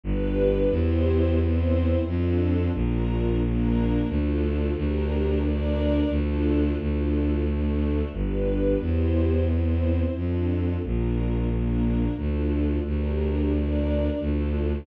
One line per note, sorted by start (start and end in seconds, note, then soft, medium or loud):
0.04 0.66 G1 loud
0.04 0.70 D4 medium
0.04 0.70 G4 medium
0.04 0.70 B4 medium
0.71 1.95 E2 medium
0.71 1.38 E4 medium
0.71 1.38 G4 medium
0.71 1.38 C5 medium
1.38 2.05 C4 medium
1.38 2.05 E4 medium
1.38 2.05 C5 medium
2.06 2.68 F2 medium
2.06 2.73 D4 medium
2.06 2.73 F4 medium
2.06 2.73 A4 medium
2.73 3.98 A#1 medium
2.73 3.40 D4 medium
2.73 3.40 F4 medium
2.73 3.40 A#4 medium
3.41 4.08 A#3 medium
3.41 4.08 D4 medium
3.41 4.08 A#4 medium
4.08 4.71 D2 medium
4.08 4.75 D4 medium
4.08 4.75 F4 medium
4.08 4.75 A4 medium
4.75 6.00 D2 medium
4.75 5.42 D4 medium
4.75 5.42 G4 medium
4.75 5.42 A#4 medium
5.43 6.10 D4 medium
5.43 6.10 A#4 medium
5.43 6.10 D5 medium
6.10 6.72 D2 medium
6.10 6.77 D4 medium
6.10 6.77 F4 medium
6.10 6.77 A4 medium
6.78 8.02 D2 medium
6.78 7.45 D4 medium
6.78 7.45 F4 medium
6.78 7.45 A4 medium
7.45 8.12 A3 medium
7.45 8.12 D4 medium
7.45 8.12 A4 medium
8.13 8.75 G1 medium
8.13 8.79 D4 medium
8.13 8.79 G4 soft
8.13 8.79 B4 medium
8.79 10.04 E2 medium
8.79 9.47 E4 medium
8.79 9.47 G4 medium
8.79 9.47 C5 medium
9.47 10.14 C4 medium
9.47 10.14 E4 medium
9.47 10.14 C5 soft
10.14 10.76 F2 medium
10.14 10.82 D4 medium
10.14 10.82 F4 soft
10.14 10.82 A4 medium
10.82 12.07 A#1 medium
10.82 11.49 D4 medium
10.82 11.49 F4 soft
10.82 11.49 A#4 medium
11.50 12.17 A#3 medium
11.50 12.17 D4 medium
11.50 12.17 A#4 medium
12.17 12.79 D2 medium
12.17 12.84 D4 soft
12.17 12.84 F4 medium
12.17 12.84 A4 soft
12.84 14.09 D2 medium
12.84 13.51 D4 medium
12.84 13.51 G4 medium
12.84 13.51 A#4 medium
13.52 14.19 D4 medium
13.52 14.19 A#4 medium
13.52 14.19 D5 medium
14.19 14.81 D2 medium
14.19 14.86 D4 medium
14.19 14.86 F4 medium
14.19 14.86 A4 medium